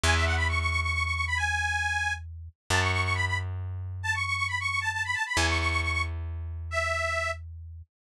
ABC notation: X:1
M:6/8
L:1/16
Q:3/8=90
K:F#m
V:1 name="Accordion"
g e f b c' c' c' c' c' c' c' b | g8 z4 | a c' c' c' b b z6 | a c' c' c' b c' c' a a b a b |
g c' c' c' c' c' z6 | e6 z6 |]
V:2 name="Electric Bass (finger)" clef=bass
E,,12- | E,,12 | F,,12- | F,,12 |
E,,12- | E,,12 |]